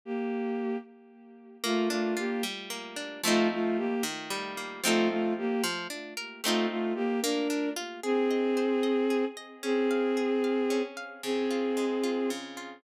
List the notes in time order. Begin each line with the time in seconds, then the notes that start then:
0.05 A#3 G4
1.63 A3 A#3 F4
1.89 A3 D4 F4
2.17 A#3 F4 G4
2.43 G3
2.70 A#3
2.96 D4
3.24 F3 A3 C4 D#4 F4
3.52 A3 F4
3.77 A#3 G4
4.03 D#3
4.30 G3
4.57 A#3
4.84 F3 A3 C4 D#4 F4 A4
5.10 A3 F4
5.38 A#3 G4
5.64 F3
5.90 D4
6.17 A#4
6.44 A3 C4 D#4 F4
6.70 A3 F4
6.95 A#3 G4
7.22 A#3 D4 A#4
7.50 D4
7.76 F4
8.03 C4 G#4
8.31 D#5
8.57 C5
8.83 D#5
9.10 G#4
9.37 D#5
9.63 C4 C#4 G#4
9.91 F5
10.17 G#4
10.44 F5
10.70 C#4
10.97 F5
11.23 C#3 C4 G#4
11.51 F4
11.77 G#3
12.04 F4
12.30 C#3
12.57 F4